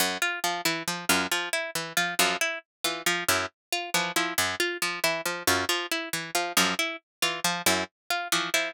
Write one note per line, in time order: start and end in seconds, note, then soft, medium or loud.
0.00 0.18 F#2 medium
0.22 0.39 F4 medium
0.44 0.61 F3 medium
0.65 0.83 E3 medium
0.65 0.83 E4 medium
0.88 1.05 F3 medium
1.09 1.27 F#2 medium
1.09 1.27 F4 medium
1.31 1.49 F3 medium
1.53 1.71 E4 medium
1.75 1.93 E3 medium
1.97 2.15 F3 medium
1.97 2.14 F4 medium
2.19 2.36 F#2 medium
2.19 2.37 F3 medium
2.41 2.59 E4 medium
2.84 3.02 E3 medium
2.84 3.02 F4 medium
3.06 3.24 F3 medium
3.28 3.46 F#2 medium
3.28 3.46 E4 medium
3.72 3.90 F4 medium
3.94 4.12 E3 medium
3.94 4.12 F3 medium
4.16 4.34 F3 medium
4.16 4.34 E4 medium
4.38 4.55 F#2 medium
4.60 4.77 F4 medium
4.82 4.99 F3 medium
5.04 5.21 E3 medium
5.04 5.21 E4 medium
5.26 5.43 F3 medium
5.47 5.65 F#2 medium
5.47 5.65 F4 medium
5.69 5.86 F3 medium
5.91 6.09 E4 medium
6.13 6.31 E3 medium
6.35 6.53 F3 medium
6.35 6.52 F4 medium
6.57 6.75 F#2 medium
6.57 6.74 F3 medium
6.79 6.96 E4 medium
7.22 7.40 E3 medium
7.22 7.40 F4 medium
7.44 7.62 F3 medium
7.66 7.84 F#2 medium
7.66 7.84 E4 medium
8.10 8.28 F4 medium
8.32 8.50 E3 medium
8.32 8.50 F3 medium
8.54 8.72 F3 medium
8.54 8.71 E4 medium